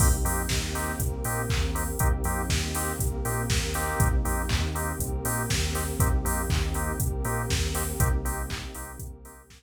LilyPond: <<
  \new Staff \with { instrumentName = "Drawbar Organ" } { \time 4/4 \key c \dorian \tempo 4 = 120 <bes c' ees' g'>8 <bes c' ees' g'>4 <bes c' ees' g'>4 <bes c' ees' g'>4 <bes c' ees' g'>8 | <bes c' ees' g'>8 <bes c' ees' g'>4 <bes c' ees' g'>4 <bes c' ees' g'>4 <bes c' ees' g'>8~ | <bes c' ees' g'>8 <bes c' ees' g'>4 <bes c' ees' g'>4 <bes c' ees' g'>4 <bes c' ees' g'>8 | <bes c' ees' g'>8 <bes c' ees' g'>4 <bes c' ees' g'>4 <bes c' ees' g'>4 <bes c' ees' g'>8 |
<bes c' ees' g'>8 <bes c' ees' g'>4 <bes c' ees' g'>4 <bes c' ees' g'>4 r8 | }
  \new Staff \with { instrumentName = "Synth Bass 2" } { \clef bass \time 4/4 \key c \dorian c,8 f,8 ees,4 c,8 bes,8 ees,4 | c,8 f,8 ees,4 c,8 bes,8 ees,4 | c,8 f,8 ees,4 c,8 bes,8 ees,4 | c,8 f,8 ees,4 c,8 bes,8 ees,4 |
c,4. c,8 c,4. r8 | }
  \new Staff \with { instrumentName = "Pad 2 (warm)" } { \time 4/4 \key c \dorian <bes c' ees' g'>2 <bes c' g' bes'>2 | <bes c' ees' g'>2 <bes c' g' bes'>2 | <bes c' ees' g'>2 <bes c' g' bes'>2 | <bes c' ees' g'>2 <bes c' g' bes'>2 |
<bes c' ees' g'>2 <bes c' g' bes'>2 | }
  \new DrumStaff \with { instrumentName = "Drums" } \drummode { \time 4/4 <cymc bd>8 hho8 <bd sn>8 hho8 <hh bd>8 hho8 <hc bd>8 hho8 | <hh bd>8 hho8 <bd sn>8 hho8 <hh bd>8 hho8 <bd sn>8 hho8 | <hh bd>8 hho8 <hc bd>8 hho8 <hh bd>8 hho8 <bd sn>8 hho8 | <hh bd>8 hho8 <hc bd>8 hho8 <hh bd>8 hho8 <bd sn>8 hho8 |
<hh bd>8 hho8 <hc bd>8 hho8 <hh bd>8 hho8 <bd sn>4 | }
>>